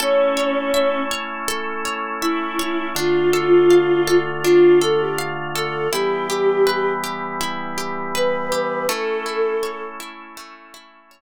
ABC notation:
X:1
M:4/4
L:1/16
Q:1/4=81
K:Amix
V:1 name="Choir Aahs"
C6 z6 E4 | =F8 F2 A G z2 A2 | G6 z6 B4 | A6 z10 |]
V:2 name="Orchestral Harp"
A2 c2 e2 c2 A2 c2 e2 c2 | D2 A2 =f2 A2 D2 A2 f2 A2 | E2 G2 B2 G2 E2 G2 B2 G2 | A,2 E2 c2 E2 A,2 E2 c2 z2 |]
V:3 name="Drawbar Organ"
[A,CE]16 | [D,A,=F]16 | [E,G,B,]16 | [A,CE]16 |]